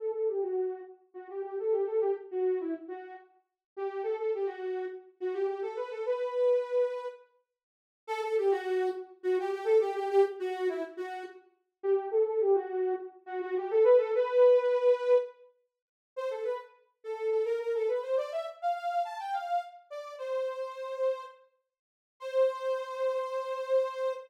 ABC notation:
X:1
M:7/8
L:1/16
Q:1/4=104
K:Amix
V:1 name="Ocarina"
A A G F3 z2 F G G A G A | G z F2 E z F2 z4 G2 | A A G F3 z2 F G G A B A | B8 z6 |
A A G F3 z2 F G G A G G | G z F2 E z F2 z4 G2 | A A G F3 z2 F F G A B A | B8 z6 |
[K:Cmix] c A =B z3 A2 A _B B A =B c | d e z f f2 a g f2 z2 d2 | c8 z6 | c14 |]